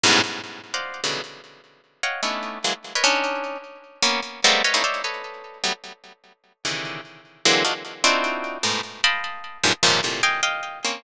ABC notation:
X:1
M:5/8
L:1/16
Q:1/4=150
K:none
V:1 name="Orchestral Harp"
[^F,,G,,^G,,A,,B,,]2 z5 [cd^d=f^f]3 | [B,,^C,D,E,^F,G,]2 z8 | [^c^df^fg]2 [A,B,^C=D^DE]4 [E,^F,^G,^A,] z2 [^ABcd] | [^CD^D]6 z4 |
[^A,B,^C]2 z2 [G,^G,=A,^A,B,=C]2 [B^c^df] [=A,^A,B,^C^DE] [=c^c=d^de]2 | [AB^c^d]6 [^F,G,A,B,] z3 | z6 [C,^C,D,^D,E,]4 | z4 [D,E,^F,^G,^A,C]2 [D^D=F^F] z3 |
[CD^DEF^F]6 [^G,,A,,B,,]2 z2 | [^dfgabc']6 [^F,,G,,^G,,^A,,] z [G,,A,,C,^C,^D,=F,]2 | [A,,^A,,C,]2 [^dfg^g]2 [df=g]4 [^A,C^C]2 |]